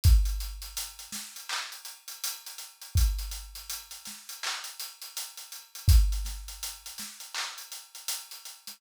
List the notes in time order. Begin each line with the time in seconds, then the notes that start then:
0.04 kick, closed hi-hat
0.25 closed hi-hat
0.40 closed hi-hat
0.62 closed hi-hat
0.77 closed hi-hat
0.99 closed hi-hat
1.12 snare, closed hi-hat
1.36 closed hi-hat
1.49 clap
1.72 closed hi-hat
1.85 closed hi-hat
2.08 closed hi-hat
2.24 closed hi-hat
2.46 closed hi-hat
2.58 closed hi-hat
2.82 closed hi-hat
2.95 kick, closed hi-hat
3.19 closed hi-hat
3.31 closed hi-hat
3.55 closed hi-hat
3.70 closed hi-hat
3.91 closed hi-hat
4.05 snare, closed hi-hat
4.29 closed hi-hat
4.43 clap
4.64 closed hi-hat
4.80 closed hi-hat
5.02 closed hi-hat
5.17 closed hi-hat
5.37 closed hi-hat
5.52 closed hi-hat
5.75 closed hi-hat
5.88 kick, closed hi-hat
6.12 closed hi-hat
6.25 snare, closed hi-hat
6.48 closed hi-hat
6.63 closed hi-hat
6.86 closed hi-hat
6.98 snare, closed hi-hat
7.20 closed hi-hat
7.34 clap
7.58 closed hi-hat
7.72 closed hi-hat
7.95 closed hi-hat
8.08 closed hi-hat
8.31 closed hi-hat
8.45 closed hi-hat
8.67 snare, closed hi-hat